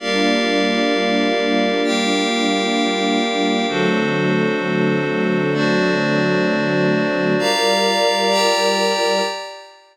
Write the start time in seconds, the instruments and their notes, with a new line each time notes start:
0.00 string ensemble 1 G3 A#3 D4 F4, pad 5 (bowed) G4 A#4 D5 F5
1.83 pad 5 (bowed) G4 A#4 F5 G5
3.68 string ensemble 1 D3 F#3 A3 C4, pad 5 (bowed) D4 F#4 A4 C5
5.54 pad 5 (bowed) D4 F#4 C5 D5
7.38 string ensemble 1 G3 F4 A#4 D5, pad 5 (bowed) G4 D5 F5 A#5
8.30 pad 5 (bowed) G4 D5 G5 A#5